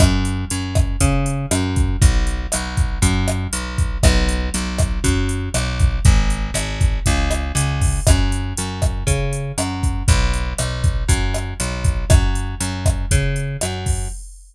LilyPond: <<
  \new Staff \with { instrumentName = "Electric Bass (finger)" } { \clef bass \time 4/4 \key fis \minor \tempo 4 = 119 fis,4 fis,4 cis4 fis,4 | b,,4 b,,4 fis,4 b,,4 | b,,4 b,,4 fis,4 b,,4 | gis,,4 gis,,4 cis,4 cis,4 |
fis,4 fis,4 cis4 fis,4 | b,,4 b,,4 fis,4 b,,4 | fis,4 fis,4 cis4 fis,4 | }
  \new DrumStaff \with { instrumentName = "Drums" } \drummode { \time 4/4 <hh bd ss>8 hh8 hh8 <hh bd ss>8 <hh bd>8 hh8 <hh ss>8 <hh bd>8 | <hh bd>8 hh8 <hh ss>8 <hh bd>8 <hh bd>8 <hh ss>8 hh8 <hh bd>8 | <hh bd ss>8 hh8 hh8 <hh bd ss>8 <hh bd>8 hh8 <hh ss>8 <hh bd>8 | <hh bd>8 hh8 <hh ss>8 <hh bd>8 <hh bd>8 <hh ss>8 hh8 <hho bd>8 |
<hh bd ss>8 hh8 hh8 <hh bd ss>8 <hh bd>8 hh8 <hh ss>8 <hh bd>8 | <hh bd>8 hh8 <hh ss>8 <hh bd>8 <hh bd>8 <hh ss>8 hh8 <hh bd>8 | <hh bd ss>8 hh8 hh8 <hh bd ss>8 <hh bd>8 hh8 <hh ss>8 <hho bd>8 | }
>>